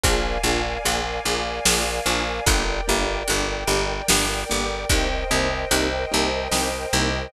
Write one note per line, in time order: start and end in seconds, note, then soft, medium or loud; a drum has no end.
0.04 0.38 A#1 medium
0.04 0.20 A#3 loud
0.04 0.20 D4 loud
0.04 0.20 F4 loud
0.04 0.20 G#4 loud
0.04 2.45 A#4 medium
0.04 2.45 D5 medium
0.04 2.45 F5 medium
0.04 2.45 G#5 medium
0.04 kick medium
0.04 closed hi-hat medium
0.44 0.78 A#1 medium
0.44 0.60 A#3 medium
0.44 0.60 D4 medium
0.44 0.60 F4 loud
0.44 0.60 G#4 loud
0.85 1.20 A#1 medium
0.85 1.01 A#3 medium
0.85 1.01 D4 loud
0.85 1.01 F4 loud
0.85 1.01 G#4 medium
0.85 closed hi-hat medium
1.25 1.60 A#1 medium
1.25 1.42 A#3 loud
1.25 1.42 D4 medium
1.25 1.42 F4 loud
1.25 1.42 G#4 medium
1.66 2.00 A#1 medium
1.66 1.82 A#3 loud
1.66 1.82 D4 loud
1.66 1.82 F4 loud
1.66 1.82 G#4 loud
1.66 snare loud
2.06 2.40 A#1 medium
2.06 2.22 A#3 loud
2.06 2.22 D4 medium
2.06 2.22 F4 loud
2.06 2.22 G#4 medium
2.46 2.81 G1 loud
2.46 2.63 A#3 loud
2.46 2.63 D4 loud
2.46 2.63 G4 loud
2.46 4.87 A#4 medium
2.46 4.87 D5 medium
2.46 4.87 G5 medium
2.46 kick medium
2.46 closed hi-hat medium
2.88 3.23 G1 medium
2.88 3.04 A#3 loud
2.88 3.04 D4 medium
2.88 3.04 G4 medium
3.28 3.64 G1 medium
3.28 3.44 A#3 loud
3.28 3.44 D4 loud
3.28 3.44 G4 medium
3.28 closed hi-hat medium
3.68 4.02 G1 medium
3.68 3.85 A#3 loud
3.68 3.85 D4 medium
3.68 3.85 G4 loud
4.08 4.44 G1 medium
4.08 4.25 A#3 loud
4.08 4.25 D4 loud
4.08 4.25 G4 loud
4.08 snare loud
4.50 4.85 G1 medium
4.50 4.66 A#3 medium
4.50 4.66 D4 loud
4.50 4.66 G4 loud
4.89 5.24 C2 medium
4.89 5.07 A#3 loud
4.89 5.07 C4 loud
4.89 5.07 D#4 loud
4.89 5.07 G4 loud
4.89 7.30 A#4 medium
4.89 7.30 C5 medium
4.89 7.30 D#5 medium
4.89 7.30 G5 medium
4.89 kick medium
4.89 closed hi-hat medium
5.31 5.65 C2 medium
5.31 5.47 A#3 loud
5.31 5.47 C4 medium
5.31 5.47 D#4 loud
5.31 5.47 G4 loud
5.71 6.06 C2 medium
5.71 5.88 A#3 medium
5.71 5.88 C4 medium
5.71 5.88 D#4 loud
5.71 5.88 G4 medium
5.71 closed hi-hat medium
6.12 6.48 C2 medium
6.12 6.28 A#3 loud
6.12 6.28 C4 medium
6.12 6.28 D#4 loud
6.12 6.28 G4 loud
6.52 6.86 C2 medium
6.52 6.69 A#3 medium
6.52 6.69 C4 loud
6.52 6.69 D#4 loud
6.52 6.69 G4 loud
6.52 snare medium
6.93 7.28 C2 medium
6.93 7.09 A#3 medium
6.93 7.09 C4 loud
6.93 7.09 D#4 loud
6.93 7.09 G4 loud